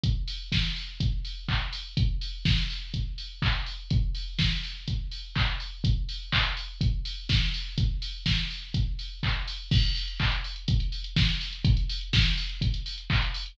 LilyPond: \new DrumStaff \drummode { \time 4/4 \tempo 4 = 124 <hh bd>8 hho8 <bd sn>8 hho8 <hh bd>8 hho8 <hc bd>8 hho8 | <hh bd>8 hho8 <bd sn>8 hho8 <hh bd>8 hho8 <hc bd>8 hho8 | <hh bd>8 hho8 <bd sn>8 hho8 <hh bd>8 hho8 <hc bd>8 hho8 | <hh bd>8 hho8 <hc bd>8 hho8 <hh bd>8 hho8 <bd sn>8 hho8 |
<hh bd>8 hho8 <bd sn>8 hho8 <hh bd>8 hho8 <hc bd>8 hho8 | <cymc bd>16 hh16 hho16 hh16 <hc bd>16 hh16 hho16 hh16 <hh bd>16 hh16 hho16 hh16 <bd sn>16 hh16 hho16 hh16 | <hh bd>16 hh16 hho16 hh16 <bd sn>16 hh16 hho16 hh16 <hh bd>16 hh16 hho16 hh16 <hc bd>16 hh16 hho16 hh16 | }